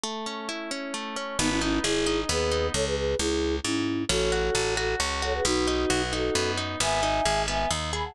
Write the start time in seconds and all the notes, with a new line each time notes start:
0.03 A3
0.26 C#4
0.49 E4
0.71 C#4
0.94 A3
1.16 C#4
1.39 G#1 B3 D#4
1.49 C#4 E4
1.61 C#4 D#4 E4
1.83 G#1 E4 G#4
2.06 D#4
2.29 D#2 B3 G#4 B4
2.51 D#4
2.74 C#2 A4 C#5
2.86 G#4 B4
2.96 G#4 B4
3.18 C#2 E4 G#4
3.63 G#2 C#4 E4
4.09 A1 C#4 F#4 A4
4.32 F#4
4.55 A1 A4
4.76 F#4 A4
5.00 C#2 C#4
5.22 F#4 A4 C#5
5.34 G#4 B4
5.45 B1 B3 D#4 F#4
5.67 D#4
5.90 B1 F#4
6.13 D#4 F#4 A4
6.35 F#2 B3
6.58 D#4
6.80 G#1 B3 E5 G#5
7.03 D#4
7.25 G#1 G#4
7.48 B3 E5 G#5
7.71 D#2 D#4
7.93 G#4 G#5 B5
8.04 F#5 A5